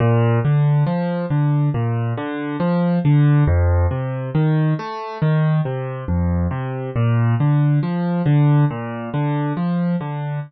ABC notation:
X:1
M:4/4
L:1/8
Q:1/4=69
K:Bb
V:1 name="Acoustic Grand Piano"
B,, D, F, D, B,, D, F, D, | F,, C, E, A, E, C, F,, C, | B,, D, F, D, B,, D, F, D, |]